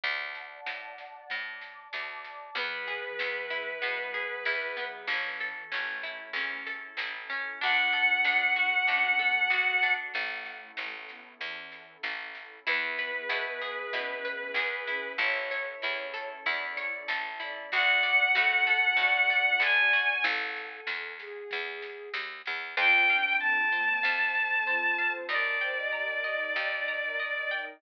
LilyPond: <<
  \new Staff \with { instrumentName = "Violin" } { \time 4/4 \key e \mixolydian \tempo 4 = 95 r1 | b'1 | r1 | fis''1 |
r1 | b'1 | r1 | fis''2. gis''4 |
r1 | \key f \mixolydian g''4 a''2. | d''1 | }
  \new Staff \with { instrumentName = "Ocarina" } { \time 4/4 \key e \mixolydian r1 | e8. e4~ e16 \tuplet 3/2 { fis8 fis8 fis8 } r8 fis8 | e8. e16 fis16 a4~ a16 r4. | d'2 cis'16 cis'16 b8 fis'8 fis'8 |
a4. b8 e4 r4 | b8. b4~ b16 \tuplet 3/2 { cis'8 cis'8 cis'8 } r8 cis'8 | cis''8. cis''4~ cis''16 \tuplet 3/2 { d''8 d''8 d''8 } r8 d''8 | d''4 a'4 d''2 |
a'4. gis'4. r4 | \key f \mixolydian f'8 d'4 bes8 f4 f'4 | bes'8 c''16 ees''8. ees''8 ees''4 r4 | }
  \new Staff \with { instrumentName = "Orchestral Harp" } { \time 4/4 \key e \mixolydian r1 | b8 gis'8 b8 e'8 b8 gis'8 e'8 b8 | cis'8 a'8 cis'8 e'8 cis'8 a'8 e'8 cis'8 | d'8 a'8 d'8 fis'8 d'8 a'8 fis'8 d'8 |
r1 | e'8 b'8 e'8 gis'8 e'8 b'8 gis'8 e'8 | e'8 cis''8 e'8 a'8 e'8 cis''8 a'8 e'8 | fis'8 d''8 fis'8 a'8 fis'8 d''8 a'8 fis'8 |
r1 | \key f \mixolydian c''8 f''8 a''8 c''8 f''8 a''8 c''8 f''8 | ees''8 g''8 bes''8 ees''8 g''8 bes''8 ees''8 g''8 | }
  \new Staff \with { instrumentName = "Electric Bass (finger)" } { \clef bass \time 4/4 \key e \mixolydian d,4 a,4 a,4 d,4 | e,4 e,4 b,4 e,4 | a,,4 a,,4 e,4 a,,4 | d,4 d,4 a,4 d,4 |
a,,4 a,,4 e,4 a,,4 | e,4 b,4 b,4 e,4 | a,,4 e,4 e,4 a,,4 | d,4 a,4 a,4 d,4 |
a,,4 e,4 e,4 dis,8 e,8 | \key f \mixolydian f,2 f,2 | ees,2 ees,2 | }
  \new Staff \with { instrumentName = "Pad 2 (warm)" } { \time 4/4 \key e \mixolydian <d'' fis'' a''>2 <d'' a'' d'''>2 | <b e' gis'>1 | <cis' e' a'>1 | <d' fis' a'>1 |
<cis' e' a'>1 | <b e' gis'>1 | <cis' e' a'>1 | <d' fis' a'>1 |
r1 | \key f \mixolydian <c' f' a'>2 <c' a' c''>2 | <ees' g' bes'>2 <ees' bes' ees''>2 | }
  \new DrumStaff \with { instrumentName = "Drums" } \drummode { \time 4/4 <bd sn>8 sn8 sn8 sn8 <bd sn>8 sn8 sn8 sn8 | <bd sn>8 sn8 sn8 sn8 sn8 sn8 sn8 sn8 | <bd sn>8 sn8 sn8 sn8 sn8 sn8 sn8 sn8 | <bd sn>8 sn8 sn8 sn8 <bd sn>8 sn8 sn8 sn8 |
<bd sn>8 sn8 sn8 sn8 <bd sn>8 sn8 sn8 sn8 | <bd sn>8 sn8 sn8 sn8 <bd sn>8 sn8 sn8 sn8 | <bd sn>8 sn8 sn8 sn8 <bd sn>8 sn8 sn8 sn8 | <bd sn>8 sn8 sn8 sn8 <bd sn>8 sn8 sn8 sn8 |
<bd sn>8 sn8 sn8 sn8 <bd sn>8 sn8 sn8 sn8 | r4 r4 r4 r4 | r4 r4 r4 r4 | }
>>